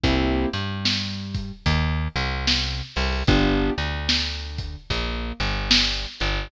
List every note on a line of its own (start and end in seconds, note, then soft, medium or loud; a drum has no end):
0.04 0.46 C2 medium
0.04 0.48 A#3 medium
0.04 0.48 C4 medium
0.04 0.48 E4 medium
0.04 0.48 G4 medium
0.04 kick medium
0.04 closed hi-hat medium
0.53 1.52 G2 medium
0.53 1.52 G3 medium
0.53 closed hi-hat medium
0.85 snare medium
1.34 kick medium
1.34 closed hi-hat medium
1.66 2.08 D#2 medium
1.66 2.08 D#3 medium
1.66 kick medium
1.66 closed hi-hat medium
2.16 2.82 C2 medium
2.16 2.82 C3 medium
2.16 closed hi-hat medium
2.47 snare medium
2.96 3.23 C2 medium
2.96 3.23 C3 medium
2.96 open hi-hat medium
3.27 3.70 G1 medium
3.27 3.73 B3 loud
3.27 3.73 D4 loud
3.27 3.73 F4 medium
3.27 3.73 G4 medium
3.27 kick loud
3.27 closed hi-hat medium
3.78 4.76 D2 medium
3.78 4.76 D3 medium
3.78 closed hi-hat medium
4.09 snare medium
4.58 kick medium
4.58 closed hi-hat medium
4.90 5.33 A#1 medium
4.90 5.33 A#3 medium
4.90 kick medium
4.90 closed hi-hat medium
5.40 6.06 G1 medium
5.40 6.06 G3 medium
5.40 closed hi-hat medium
5.71 snare loud
6.20 6.48 G1 medium
6.20 6.48 G3 medium
6.20 closed hi-hat medium